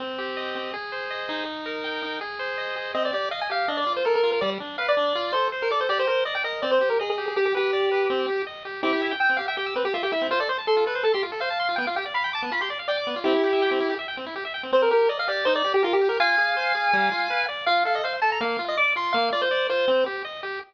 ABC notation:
X:1
M:4/4
L:1/16
Q:1/4=163
K:Cm
V:1 name="Lead 1 (square)"
z16 | z16 | e d d2 f a f2 e d2 c B B2 B | d z3 f d5 c2 z B d c |
d c c2 e g e2 d c2 B A A2 A | G G G10 z4 | [K:C] [EG]4 g2 f g G2 B G F G E2 | c d c z A2 B2 A G z2 f4 |
g f g z b2 a2 b c' z2 d4 | [EG]8 z8 | [K:Cm] c B B2 d f d2 c d2 G F G2 B | [fa]16 |
f2 f e f z =a b f3 e d'2 c'2 | f2 d c3 c4 z6 |]
V:2 name="Lead 1 (square)"
C2 G2 e2 C2 A2 c2 e2 E2- | E2 B2 g2 E2 A2 c2 e2 A2 | C2 G2 e2 G2 D2 F2 =A2 F2 | G,2 D2 =B2 D2 F2 =A2 c2 A2 |
G2 B2 d2 B2 C2 G2 e2 G2 | G2 =B2 d2 B2 C2 G2 e2 G2 | [K:C] C G e g e' C G e g e' C G e g e' C | F A c a c' F A c a c' F A c a c' F |
B, F G d f g d' B, F G d f g d' B, F | C E G e g C E G e g C E G e g C | [K:Cm] C2 G2 e2 G2 E2 G2 B2 G2 | F2 A2 c2 A2 G,2 F2 =B2 d2 |
F2 =A2 c2 A2 B,2 F2 d2 F2 | B,2 F2 d2 F2 C2 G2 e2 G2 |]